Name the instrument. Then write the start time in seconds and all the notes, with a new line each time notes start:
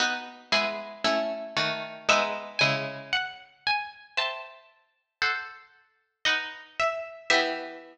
harpsichord
0.00 B3 D#4 F#4
0.52 G#3 B3 E4 G#5
1.04 A3 C#4 E4
1.57 D#3 A3 F#4
2.09 G#3 B3 D#4 E5
2.59 C#3 G#3 E4 G#5
3.13 F#5
3.67 G#5
4.17 C5 E5 G5 A5
5.22 A4 C5 F#5
6.25 D#4 B4 D#5 F#5
6.80 E5
7.30 E3 B3 G4 E5